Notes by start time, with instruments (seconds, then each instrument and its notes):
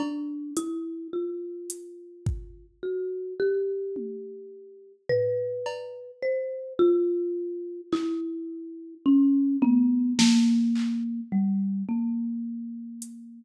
0.00 marimba D4, cowbell
0.57 marimba E4, closed hi-hat
1.13 marimba F4
1.70 closed hi-hat
2.26 kick
2.83 marimba F#4
3.40 marimba G4
3.96 high tom
5.09 marimba B4, floor tom
5.66 cowbell
6.22 marimba C5
6.79 marimba F4
7.92 marimba E4, clap
9.06 marimba C#4
9.62 marimba B3, high tom
10.19 marimba A#3, snare
10.75 clap
11.32 marimba G3
11.89 marimba A#3
13.02 closed hi-hat